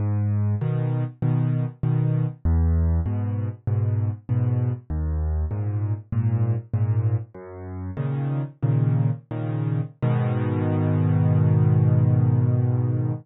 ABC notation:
X:1
M:4/4
L:1/8
Q:1/4=98
K:G#m
V:1 name="Acoustic Grand Piano" clef=bass
G,,2 [B,,D,]2 [B,,D,]2 [B,,D,]2 | E,,2 [G,,B,,]2 [G,,B,,]2 [G,,B,,]2 | D,,2 [G,,A,,]2 [G,,A,,]2 [G,,A,,]2 | "^rit." F,,2 [A,,C,D,]2 [A,,C,D,]2 [A,,C,D,]2 |
[G,,B,,D,]8 |]